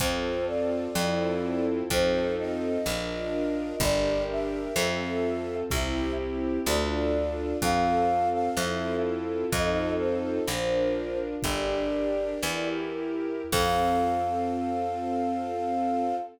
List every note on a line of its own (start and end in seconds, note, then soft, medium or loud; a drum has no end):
0.00 0.88 F2 loud
0.00 0.85 C4 loud
0.00 0.95 C4 loud
0.00 0.85 F4 loud
0.00 0.95 F4 medium
0.00 0.85 A4 loud
0.00 0.95 A4 medium
0.00 0.45 C5 loud
0.00 kick loud
0.00 closed hi-hat loud
0.47 1.64 D5 loud
0.95 1.83 F2 medium
0.95 1.81 C4 loud
0.95 1.90 C4 medium
0.95 1.81 E4 loud
0.95 1.90 E4 loud
0.95 1.81 F4 loud
0.95 1.90 F4 medium
0.95 1.81 A4 loud
0.95 1.90 A4 medium
0.95 snare loud
1.90 2.78 F2 loud
1.90 2.75 C4 loud
1.90 2.85 C4 medium
1.90 2.75 D#4 loud
1.90 2.85 D#4 loud
1.90 2.75 F4 medium
1.90 2.85 F4 loud
1.90 2.75 A4 loud
1.90 2.85 A4 loud
1.90 2.33 C5 loud
1.90 kick loud
1.90 closed hi-hat loud
2.38 3.76 D#5 loud
2.85 3.73 A#1 medium
2.85 3.80 D4 loud
2.85 3.73 D4 loud
2.85 3.80 F4 medium
2.85 3.73 F4 loud
2.85 3.80 A#4 loud
2.85 3.73 A#4 loud
2.85 snare loud
3.80 4.68 G1 loud
3.80 4.74 D4 loud
3.80 4.67 D4 loud
3.80 4.74 G4 loud
3.80 4.67 G4 loud
3.80 4.74 A#4 loud
3.80 4.67 A#4 medium
3.80 4.23 D5 loud
3.80 kick loud
3.80 closed hi-hat loud
4.31 5.55 E5 loud
4.75 5.63 F2 loud
4.75 5.61 C4 medium
4.75 5.71 C4 loud
4.75 5.61 F4 loud
4.75 5.71 F4 medium
4.75 5.61 A4 loud
4.75 5.71 A4 medium
4.75 snare loud
5.71 6.59 C2 medium
5.71 6.66 C4 loud
5.71 6.58 C4 loud
5.71 6.66 E4 medium
5.71 6.58 E4 loud
5.71 6.66 G4 medium
5.71 6.58 G4 loud
5.71 6.12 E5 loud
5.71 kick loud
5.71 closed hi-hat medium
6.65 7.54 D2 loud
6.65 7.53 D4 loud
6.65 7.62 D4 medium
6.65 7.53 F4 loud
6.65 7.62 F4 loud
6.65 7.53 A4 loud
6.65 7.62 A4 loud
6.65 7.58 D5 medium
6.65 snare medium
7.62 8.50 F2 medium
7.62 8.48 C4 medium
7.62 8.57 C4 medium
7.62 8.48 F4 medium
7.62 8.57 F4 medium
7.62 8.48 A4 loud
7.62 8.57 A4 medium
7.62 8.28 F5 loud
7.62 kick loud
7.62 closed hi-hat loud
8.32 8.55 F5 loud
8.56 9.45 F2 medium
8.56 9.52 C4 medium
8.56 9.44 C4 medium
8.56 9.52 E4 medium
8.56 9.44 E4 loud
8.56 9.52 F4 medium
8.56 9.44 F4 loud
8.56 9.52 A4 loud
8.56 9.44 A4 loud
8.56 8.95 E5 loud
8.56 snare loud
9.52 10.40 F2 medium
9.52 10.38 C4 medium
9.52 10.47 C4 medium
9.52 10.38 D#4 loud
9.52 10.47 D#4 loud
9.52 10.38 F4 loud
9.52 10.47 F4 medium
9.52 10.38 A4 loud
9.52 10.47 A4 loud
9.52 9.91 D#5 loud
9.52 kick loud
9.52 closed hi-hat loud
9.98 11.18 C5 medium
10.47 11.35 A#1 medium
10.47 11.42 D4 medium
10.47 11.35 D4 loud
10.47 11.42 F4 medium
10.47 11.35 F4 medium
10.47 11.42 A#4 loud
10.47 11.35 A#4 loud
10.47 snare loud
11.42 12.35 G1 medium
11.42 12.41 D4 medium
11.42 12.33 D4 loud
11.42 12.41 G4 medium
11.42 12.33 G4 loud
11.42 12.41 A#4 loud
11.42 12.33 A#4 medium
11.42 12.66 D5 loud
11.42 kick loud
11.42 closed hi-hat loud
12.42 13.44 E2 medium
12.42 13.51 E4 medium
12.42 13.42 E4 loud
12.42 13.51 G4 medium
12.42 13.42 G4 loud
12.42 13.51 A#4 medium
12.42 13.42 A#4 loud
12.42 snare loud
13.52 16.14 F2 loud
13.52 16.14 C4 medium
13.52 16.15 C4 loud
13.52 16.14 F4 medium
13.52 16.15 F4 loud
13.52 16.14 A4 medium
13.52 16.15 A4 loud
13.52 16.16 F5 loud
13.52 kick loud
13.52 crash loud